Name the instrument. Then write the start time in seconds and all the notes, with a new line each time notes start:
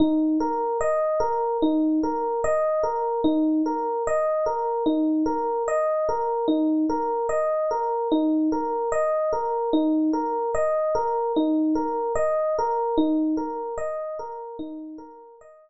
electric piano 1
0.00 D#4
0.40 A#4
0.81 D#5
1.20 A#4
1.62 D#4
2.03 A#4
2.44 D#5
2.83 A#4
3.24 D#4
3.66 A#4
4.07 D#5
4.46 A#4
4.86 D#4
5.26 A#4
5.68 D#5
6.09 A#4
6.48 D#4
6.90 A#4
7.29 D#5
7.71 A#4
8.12 D#4
8.52 A#4
8.92 D#5
9.33 A#4
9.73 D#4
10.13 A#4
10.55 D#5
10.95 A#4
11.36 D#4
11.75 A#4
12.16 D#5
12.58 A#4
12.98 D#4
13.37 A#4
13.78 D#5
14.19 A#4
14.59 D#4
14.98 A#4
15.41 D#5